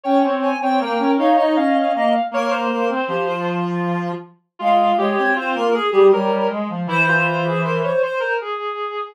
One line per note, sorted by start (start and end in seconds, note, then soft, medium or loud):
0.03 0.23 C#4 medium
0.03 0.50 C#5 medium
0.03 0.22 G5 loud
0.23 0.53 C4 medium
0.42 0.60 G#5 medium
0.61 0.79 C4 medium
0.61 0.81 C#5 medium
0.61 0.80 G5 loud
0.80 0.98 A#3 medium
0.80 1.15 A#4 medium
0.80 1.11 G5 medium
0.99 1.17 C#4 medium
1.17 1.35 D#4 medium
1.17 1.37 C#5 medium
1.17 1.37 F5 medium
1.36 1.56 D#4 medium
1.36 1.55 C#5 medium
1.36 1.54 D#5 loud
1.56 1.74 C#4 medium
1.56 1.91 D#5 loud
1.56 1.74 F5 medium
1.75 1.93 C#4 medium
1.75 2.22 F5 medium
1.95 2.13 A#3 medium
1.95 2.13 D#5 loud
2.31 2.67 A#3 loud
2.31 2.51 A#4 loud
2.31 2.52 C#5 medium
2.50 2.70 A#4 loud
2.50 3.58 C5 medium
2.70 2.89 A#3 medium
2.70 2.88 A#4 loud
2.90 3.08 C4 medium
3.08 4.12 F3 medium
3.08 3.26 G4 medium
3.27 4.12 F4 medium
4.59 4.93 G#3 medium
4.59 4.96 F4 medium
4.59 4.97 F5 loud
4.97 5.16 G#3 medium
4.97 5.30 G4 medium
4.97 5.16 C#5 medium
5.17 5.35 C4 medium
5.17 5.35 C#5 loud
5.35 5.53 C4 medium
5.35 5.67 F4 medium
5.35 5.55 C5 medium
5.55 5.73 A#3 medium
5.55 5.73 A#4 loud
5.73 5.91 G#4 loud
5.73 6.07 G#4 medium
5.92 6.11 G3 medium
5.92 6.10 G4 loud
6.12 6.30 G3 medium
6.12 6.48 A#4 medium
6.12 6.47 C#5 loud
6.30 6.48 G3 medium
6.50 6.68 G#3 medium
6.69 6.87 F3 medium
6.87 7.88 E3 loud
6.87 7.06 E4 medium
6.87 7.63 C5 loud
7.08 7.44 F4 medium
7.46 7.64 G#4 medium
7.64 7.82 A#4 medium
7.64 7.82 C5 medium
7.84 8.02 C5 medium
7.84 8.02 C#5 medium
8.03 8.21 C5 medium
8.03 8.34 C5 medium
8.20 8.38 A#4 medium
8.41 9.13 G#4 medium